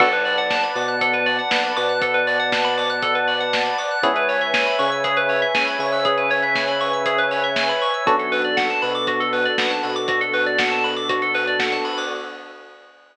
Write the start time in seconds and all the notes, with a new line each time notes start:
0.00 B1 B3 D4 F#4 A4 B4 D5 F#5 A5, kick, crash
0.13 B4, closed hi-hat
0.25 D5, open hi-hat
0.38 F#5, closed hi-hat
0.50 A5, kick, snare
0.63 B5, closed hi-hat
0.75 B2 B3 D6, open hi-hat
0.88 F#6, closed hi-hat
1.01 A4, kick, closed hi-hat
1.13 B4, closed hi-hat
1.26 D5, open hi-hat
1.38 F#5, closed hi-hat
1.51 B1 B3 A5, kick, snare
1.64 B5, closed hi-hat
1.76 B2 B3 D6, open hi-hat
1.89 F#6, closed hi-hat
2.02 A4, kick, closed hi-hat
2.14 B4, closed hi-hat
2.27 D5, open hi-hat
2.39 F#5, closed hi-hat
2.52 A5, kick, snare
2.64 B5, closed hi-hat
2.78 D6, open hi-hat
2.89 F#6, closed hi-hat
3.02 A4, kick, closed hi-hat
3.15 B4, closed hi-hat
3.28 D5, open hi-hat
3.40 F#5, closed hi-hat
3.53 A5, kick, snare
3.65 B5, closed hi-hat
3.78 D6, open hi-hat
3.91 F#6, closed hi-hat
4.02 C#2 B3 C#4 E4 G#4 B4 C#5 E5 G#5, kick, closed hi-hat
4.16 B4, closed hi-hat
4.29 C#5, open hi-hat
4.41 E5, closed hi-hat
4.54 G#5, kick, snare
4.66 B5, closed hi-hat
4.79 C#3 C#4 C#6, open hi-hat
4.92 E6, closed hi-hat
5.04 G#4, kick, closed hi-hat
5.17 B4, closed hi-hat
5.29 C#5, open hi-hat
5.42 E5, closed hi-hat
5.54 C#2 C#3 G#5, kick, snare
5.67 B5, closed hi-hat
5.79 C#3 C#4 C#6, open hi-hat
5.92 E6, open hi-hat
6.05 G#4, kick, closed hi-hat
6.18 B4, closed hi-hat
6.30 C#5, open hi-hat
6.42 E5, closed hi-hat
6.55 G#5, kick, snare
6.68 B5, closed hi-hat
6.80 C#6, open hi-hat
6.93 E6, closed hi-hat
7.05 G#4, kick, closed hi-hat
7.18 B4, closed hi-hat
7.31 C#5, open hi-hat
7.44 E5, closed hi-hat
7.56 G#5, kick, snare
7.69 B5, closed hi-hat
7.82 C#6, open hi-hat
7.94 E6, closed hi-hat
8.06 B1 B3 D4 F#4 A4, kick, closed hi-hat
8.19 A4, closed hi-hat
8.32 B4, open hi-hat
8.44 D5, closed hi-hat
8.57 F#5, kick, snare
8.70 A5, closed hi-hat
8.82 B2 B3 B5, open hi-hat
8.94 D6, closed hi-hat
9.07 F#4, kick, closed hi-hat
9.20 A4, closed hi-hat
9.33 B4, open hi-hat
9.45 D5, closed hi-hat
9.58 B1 B3 F#5, kick, snare
9.70 A5, closed hi-hat
9.83 B2 B3 B5, open hi-hat
9.96 D6, closed hi-hat
10.08 F#4, kick, closed hi-hat
10.21 A4, closed hi-hat
10.33 B4, open hi-hat
10.46 D5, closed hi-hat
10.59 F#5, kick, snare
10.71 A5, closed hi-hat
10.84 B5, open hi-hat
10.96 D6, closed hi-hat
11.09 F#4, kick, closed hi-hat
11.22 A4, closed hi-hat
11.34 B4, open hi-hat
11.47 D5, closed hi-hat
11.59 F#5, kick, snare
11.72 A5, closed hi-hat
11.85 B5, open hi-hat
11.97 D6, open hi-hat